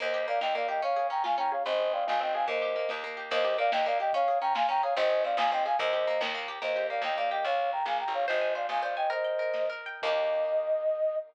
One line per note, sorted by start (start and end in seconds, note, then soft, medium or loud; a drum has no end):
0.00 0.40 D#2 medium
0.00 0.27 A#3 medium
0.00 0.23 C5 medium
0.00 0.23 D#5 medium
0.00 kick medium
0.00 crash medium
0.14 0.68 G4 medium
0.21 closed hi-hat medium
0.28 0.55 A#3 medium
0.28 0.40 D5 medium
0.28 0.40 F5 medium
0.41 0.81 D#2 medium
0.41 0.81 D#4 medium
0.41 0.54 D#5 medium
0.41 0.54 G5 medium
0.41 snare loud
0.55 0.81 A#3 medium
0.55 0.67 D5 medium
0.55 0.67 F5 medium
0.61 closed hi-hat medium
0.68 0.82 G4 medium
0.68 0.81 D#5 medium
0.68 0.81 G5 medium
0.82 1.09 C#4 medium
0.82 1.07 C#5 medium
0.82 1.07 F5 medium
0.82 kick medium
0.82 closed hi-hat medium
0.96 1.51 G#4 medium
1.04 closed hi-hat medium
1.10 1.37 C#4 medium
1.10 1.23 G5 medium
1.10 1.23 A#5 medium
1.24 1.63 F4 medium
1.24 1.36 F5 medium
1.24 1.36 G#5 medium
1.24 snare medium
1.38 1.64 C#4 medium
1.38 1.51 G5 medium
1.38 1.51 A#5 medium
1.44 closed hi-hat medium
1.52 1.65 G#4 medium
1.52 1.63 C#5 medium
1.52 1.63 F5 medium
1.65 2.04 G#1 medium
1.65 1.93 C4 medium
1.65 1.90 C5 medium
1.65 1.90 D#5 medium
1.65 kick loud
1.65 closed hi-hat medium
1.80 2.34 G#4 medium
1.85 closed hi-hat medium
1.93 2.20 C4 medium
1.93 2.06 D5 medium
1.93 2.06 F5 medium
2.07 2.47 G#1 medium
2.07 2.47 D#4 medium
2.07 2.20 F5 medium
2.07 2.20 G#5 medium
2.07 snare loud
2.20 2.47 C4 medium
2.20 2.32 D#5 medium
2.20 2.32 G5 medium
2.28 closed hi-hat medium
2.34 2.48 G#4 medium
2.34 2.45 F5 medium
2.34 2.45 G#5 medium
2.48 2.86 D#2 medium
2.48 2.75 A#3 medium
2.48 2.87 C5 medium
2.48 2.87 D#5 medium
2.48 kick loud
2.48 closed hi-hat medium
2.62 3.16 G4 medium
2.70 closed hi-hat medium
2.76 3.03 A#3 medium
2.89 3.29 D#2 medium
2.89 3.29 D#4 medium
2.89 snare loud
3.04 3.30 A#3 medium
3.10 closed hi-hat medium
3.17 3.30 G4 medium
3.31 3.69 D#2 loud
3.31 3.45 A#3 loud
3.31 3.54 C5 medium
3.31 3.54 D#5 medium
3.31 kick loud
3.31 crash loud
3.44 3.58 G4 medium
3.51 closed hi-hat medium
3.58 3.72 A#3 medium
3.58 3.71 D5 medium
3.58 3.71 F5 loud
3.72 4.11 D#2 medium
3.72 3.86 D#4 medium
3.72 3.85 D#5 medium
3.72 3.85 G5 medium
3.72 snare loud
3.86 4.00 A#3 medium
3.86 3.98 D5 medium
3.86 3.98 F5 loud
3.94 closed hi-hat medium
4.00 4.13 G4 medium
4.00 4.12 D#5 medium
4.00 4.12 G5 medium
4.13 4.28 C#4 loud
4.13 4.38 C#5 medium
4.13 4.38 F5 loud
4.13 kick loud
4.13 closed hi-hat loud
4.28 4.42 G#4 medium
4.33 closed hi-hat medium
4.41 4.55 C#4 medium
4.41 4.53 G5 medium
4.41 4.53 A#5 loud
4.55 4.69 F4 medium
4.55 4.67 F5 medium
4.55 4.67 G#5 loud
4.55 snare loud
4.69 4.83 C#4 medium
4.69 4.82 G5 loud
4.69 4.82 A#5 loud
4.77 closed hi-hat medium
4.83 4.96 G#4 medium
4.83 4.94 C#5 medium
4.83 4.94 F5 medium
4.96 5.35 G#1 loud
4.96 5.10 C4 loud
4.96 5.21 C5 loud
4.96 5.21 D#5 loud
4.96 kick loud
4.96 closed hi-hat loud
5.10 5.24 G#4 medium
5.17 closed hi-hat medium
5.24 5.38 C4 medium
5.24 5.37 D5 medium
5.24 5.37 F5 medium
5.37 5.75 G#1 loud
5.37 5.52 D#4 medium
5.37 5.51 F5 medium
5.37 5.51 G#5 loud
5.37 snare loud
5.52 5.66 C4 medium
5.52 5.63 D#5 medium
5.52 5.63 G5 medium
5.59 closed hi-hat medium
5.66 5.79 G#4 medium
5.66 5.77 F5 medium
5.66 5.77 G#5 medium
5.79 6.18 D#2 loud
5.79 5.93 A#3 loud
5.79 6.18 C5 medium
5.79 6.18 D#5 medium
5.79 kick loud
5.79 closed hi-hat loud
5.93 6.07 G4 medium
6.00 closed hi-hat medium
6.07 6.21 A#3 medium
6.21 6.59 D#2 loud
6.21 6.34 D#4 medium
6.21 snare loud
6.35 6.48 A#3 medium
6.42 closed hi-hat medium
6.48 6.61 G4 medium
6.62 7.00 D#2 medium
6.62 6.90 A#3 medium
6.62 6.84 C5 medium
6.62 6.84 D#5 medium
6.62 kick medium
6.62 crash medium
6.76 7.31 G4 medium
6.82 closed hi-hat medium
6.90 7.17 A#3 medium
6.90 7.02 D5 medium
6.90 7.02 F5 medium
7.02 7.40 D#2 medium
7.02 7.43 D#4 medium
7.02 7.16 D#5 medium
7.02 7.16 G5 medium
7.02 snare loud
7.17 7.44 A#3 medium
7.17 7.30 D5 medium
7.17 7.30 F5 medium
7.24 open hi-hat medium
7.31 7.44 G4 medium
7.31 7.44 D#5 medium
7.31 7.44 G5 medium
7.44 7.83 C#2 medium
7.44 7.71 C#5 medium
7.44 7.71 F5 medium
7.44 kick medium
7.44 closed hi-hat loud
7.65 closed hi-hat medium
7.72 7.85 G5 medium
7.72 7.85 A#5 medium
7.86 8.04 A#1 medium
7.86 7.97 F5 medium
7.86 7.97 G#5 medium
7.86 snare medium
8.00 8.13 G5 medium
8.00 8.13 A#5 medium
8.06 8.26 A1 medium
8.06 closed hi-hat medium
8.14 8.25 C#5 medium
8.14 8.25 F5 medium
8.26 8.68 G#1 medium
8.26 8.51 C5 medium
8.26 8.55 C5 medium
8.26 8.51 D#5 medium
8.26 kick medium
8.26 closed hi-hat medium
8.41 8.96 G#5 medium
8.48 closed hi-hat medium
8.55 8.82 C5 medium
8.55 8.66 D5 medium
8.55 8.66 F5 medium
8.69 9.07 G#1 medium
8.69 9.08 D#5 medium
8.69 8.81 F5 medium
8.69 8.81 G#5 medium
8.69 snare medium
8.82 9.09 C5 medium
8.82 8.95 D5 soft
8.82 8.95 F5 medium
8.88 closed hi-hat medium
8.96 9.10 D#5 medium
8.96 9.10 G5 medium
8.96 9.10 G#5 medium
9.10 9.39 A#4 medium
9.10 9.66 C5 medium
9.10 9.66 D#5 medium
9.10 kick medium
9.10 closed hi-hat medium
9.24 9.86 G5 medium
9.31 closed hi-hat medium
9.39 9.69 A#4 medium
9.54 10.00 D#5 medium
9.54 snare medium
9.70 10.01 A#4 medium
9.78 closed hi-hat medium
9.86 10.02 G5 medium
10.02 11.17 D#2 medium
10.02 11.17 A#3 medium
10.02 11.17 D#4 loud
10.02 11.16 D#5 loud
10.02 kick loud
10.02 crash loud
10.07 11.17 G4 medium